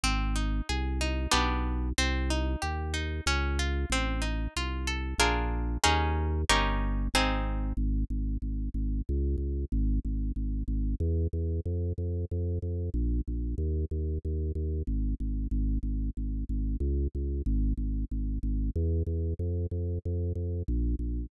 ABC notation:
X:1
M:3/4
L:1/8
Q:1/4=93
K:Ab
V:1 name="Orchestral Harp"
C E A E [=B,=DG]2 | C E G E D F | C E F =A [=DF_AB]2 | [DEAB]2 [DEGB]2 [CEA]2 |
z6 | z6 | z6 | z6 |
z6 | z6 | z6 |]
V:2 name="Drawbar Organ" clef=bass
A,,,2 C,,2 =B,,,2 | C,,2 E,,2 D,,2 | =A,,,2 C,,2 B,,,2 | E,,2 G,,,2 A,,,2 |
A,,, A,,, A,,, A,,, D,, D,, | A,,, A,,, A,,, A,,, =E,, E,, | F,, F,, F,, F,, B,,, B,,, | E,, E,, E,, E,, A,,, A,,, |
A,,, A,,, A,,, A,,, D,, D,, | A,,, A,,, A,,, A,,, =E,, E,, | F,, F,, F,, F,, B,,, B,,, |]